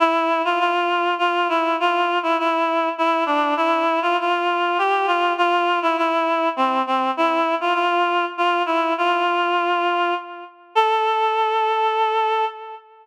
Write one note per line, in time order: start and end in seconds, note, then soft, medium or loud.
0.00 0.42 E4 medium
0.45 0.59 F4 medium
0.59 1.14 F4 medium
1.18 1.48 F4 medium
1.49 1.76 E4 medium
1.80 2.19 F4 medium
2.23 2.37 E4 medium
2.39 2.89 E4 medium
2.98 3.24 E4 medium
3.26 3.54 D4 medium
3.57 3.99 E4 loud
4.02 4.16 F4 loud
4.20 4.78 F4 medium
4.78 5.06 G4 medium
5.07 5.33 F4 medium
5.38 5.79 F4 loud
5.82 5.96 E4 medium
5.97 6.49 E4 medium
6.56 6.82 C4 medium
6.87 7.11 C4 medium
7.17 7.55 E4 loud
7.61 7.74 F4 medium
7.74 8.25 F4 medium
8.38 8.63 F4 medium
8.66 8.93 E4 medium
8.98 10.14 F4 medium
10.75 12.45 A4 loud